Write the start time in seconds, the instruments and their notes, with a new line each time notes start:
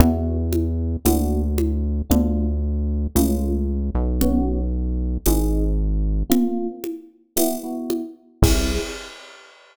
0.00 synth bass 1 E2, electric piano 1 B3 E4 F#4, low conga
0.53 high conga
1.05 synth bass 1 D2, electric piano 1 A#3 D4 F#4, tambourine, high conga
1.58 high conga
2.10 synth bass 1 D2, electric piano 1 A3 D4 F4, low conga
3.15 synth bass 1 C#2, electric piano 1 A3 C#4 F4, tambourine, high conga
3.95 synth bass 1 B1
4.21 electric piano 1 B3 C#4 F#4, low conga
5.26 synth bass 1 G#1, electric piano 1 C4 D#4 G#4, tambourine, high conga
6.30 electric piano 1 A#3 C4 F4, low conga
6.84 high conga
7.36 electric piano 1 B3 E4 F#4, tambourine, high conga
7.63 electric piano 1 B3 E4 F#4
7.90 high conga
8.42 synth bass 1 C2, electric piano 1 C4 E4 G#4, kick, crash